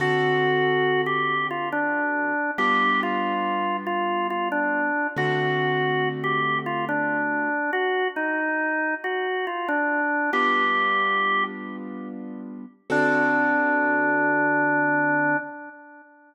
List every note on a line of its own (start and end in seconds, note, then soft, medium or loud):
0.00 2.32 D3 medium
0.00 2.32 C4 medium
0.00 2.32 F#4 medium
0.00 1.01 F#4 loud
0.00 2.32 A4 loud
1.06 1.47 G4 medium
1.51 1.69 F4 medium
1.72 2.51 D4 medium
2.58 4.90 G3 medium
2.58 4.90 B3 medium
2.58 4.90 D4 medium
2.58 4.90 F4 medium
2.58 3.00 G4 medium
3.03 3.77 F4 medium
3.87 4.27 F4 medium
4.30 4.48 F4 medium
4.52 5.07 D4 medium
5.16 7.49 D3 medium
5.16 7.49 A3 medium
5.16 7.49 C4 medium
5.16 7.49 F#4 medium
5.16 6.09 F#4 medium
6.24 6.58 G4 medium
6.66 6.85 F4 medium
6.89 7.71 D4 medium
7.73 8.08 F#4 medium
8.16 8.95 D#4 medium
9.04 9.46 F#4 medium
9.47 9.68 F4 medium
9.68 10.30 D4 medium
10.33 12.65 G3 medium
10.33 12.65 B3 medium
10.33 12.65 D4 medium
10.33 12.65 F4 medium
10.33 11.44 G4 medium
12.90 15.35 D3 medium
12.90 15.35 C4 loud
12.90 15.37 D4 loud
12.90 15.35 F#4 loud
12.90 15.35 A4 loud